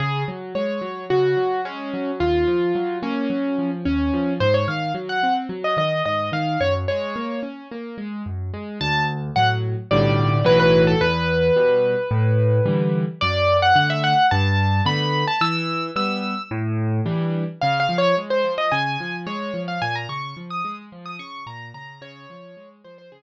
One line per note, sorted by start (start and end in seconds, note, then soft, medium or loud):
0.00 0.24 C#3 medium
0.00 0.23 G#4 medium
0.28 0.53 F#3 medium
0.55 0.80 G#3 medium
0.55 1.04 C#5 medium
0.81 1.06 F#3 medium
1.10 1.35 C#3 medium
1.10 1.61 F#4 medium
1.37 1.62 F#3 medium
1.65 1.90 G#3 medium
1.65 2.11 C#4 medium
1.94 2.18 F#3 medium
2.20 2.45 D#2 medium
2.20 2.98 F4 medium
2.47 2.72 F3 medium
2.75 3.00 F#3 medium
3.03 3.27 A#3 medium
3.03 3.71 C#4 medium
3.30 3.55 F#3 medium
3.58 3.83 F3 medium
3.85 4.11 D#2 medium
3.85 4.33 C#4 medium
4.14 4.38 F3 medium
4.40 4.65 G#2 medium
4.40 4.53 C5 loud
4.54 4.67 C#5 medium
4.68 4.92 D#3 medium
4.68 4.92 F5 medium
4.94 5.19 F#3 medium
5.09 5.34 F#5 medium
5.23 5.48 C4 medium
5.49 5.74 F#3 medium
5.64 5.77 D#5 medium
5.77 6.02 D#3 medium
5.77 6.03 D#5 medium
6.06 6.30 G#2 medium
6.06 6.30 D#5 medium
6.32 6.57 D#3 medium
6.32 6.60 F5 medium
6.61 6.85 F#2 medium
6.61 6.74 C#5 medium
6.88 7.14 G#3 medium
6.88 7.40 C#5 medium
7.16 7.41 A#3 medium
7.43 7.67 C#4 medium
7.71 7.96 A#3 medium
7.98 8.22 G#3 medium
8.26 8.51 F#2 medium
8.54 8.78 G#3 medium
8.81 9.30 D2 loud
8.81 9.03 A5 loud
9.36 9.75 A2 medium
9.36 9.75 F#3 medium
9.36 9.49 F#5 loud
9.91 10.41 B1 loud
9.91 10.41 A2 loud
9.91 10.41 D3 medium
9.91 10.41 G3 loud
9.91 10.44 D5 medium
10.44 10.94 B1 medium
10.44 10.94 A2 medium
10.44 10.94 E3 loud
10.44 10.94 F#3 loud
10.44 10.59 B4 loud
10.60 10.82 B4 loud
10.87 11.00 A4 loud
11.01 11.51 E2 loud
11.01 12.98 B4 loud
11.56 11.95 B2 medium
11.56 11.95 G3 medium
12.11 12.60 A2 loud
12.66 13.04 D3 medium
12.66 13.04 E3 medium
12.66 13.04 G3 medium
13.21 13.72 F#2 medium
13.21 13.57 D5 loud
13.62 13.75 F#5 loud
13.75 14.14 D3 medium
13.75 14.14 A3 medium
13.75 13.89 F#5 loud
13.90 14.03 E5 loud
14.04 14.26 F#5 loud
14.31 14.81 G2 loud
14.31 14.81 A5 loud
14.85 15.24 D3 medium
14.85 15.24 A3 medium
14.85 15.24 B3 medium
14.85 15.26 B5 loud
15.28 15.41 A5 loud
15.41 15.90 E3 medium
15.41 15.87 E6 loud
15.96 16.34 G3 medium
15.96 16.34 B3 medium
15.96 16.42 E6 loud
16.51 17.01 A2 loud
17.06 17.44 E3 medium
17.06 17.44 G3 medium
17.06 17.44 D4 medium
17.61 17.88 C#3 loud
17.61 17.79 F5 loud
17.80 17.97 F5 loud
17.89 18.14 F3 medium
17.98 18.16 C#5 loud
18.17 18.42 G#3 medium
18.30 18.53 C5 medium
18.44 18.69 F3 medium
18.58 18.71 D#5 loud
18.72 18.97 C#3 medium
18.72 19.16 G#5 loud
19.00 19.25 F3 medium
19.27 19.51 G#3 medium
19.27 19.61 C#5 medium
19.54 19.79 F3 medium
19.68 19.81 F5 medium
19.82 20.07 A#2 loud
19.82 19.95 G#5 loud
19.95 20.08 A#5 medium
20.09 20.34 C#3 medium
20.09 20.35 C#6 medium
20.37 20.61 F3 medium
20.50 20.75 D#6 loud
20.65 20.89 G#3 medium
20.92 21.17 F3 medium
21.06 21.19 D#6 loud
21.19 21.44 C#3 medium
21.19 21.44 C#6 loud
21.47 21.71 A#2 medium
21.47 21.69 A#5 medium
21.74 21.99 C#3 medium
21.74 22.01 A#5 medium
22.01 22.26 C#3 loud
22.01 22.69 C#5 loud
22.30 22.55 F3 medium
22.57 22.82 G#3 medium
22.84 23.10 F3 medium
22.84 22.97 C5 medium
22.98 23.11 C5 loud
23.12 23.22 C#3 medium
23.12 23.22 G#4 loud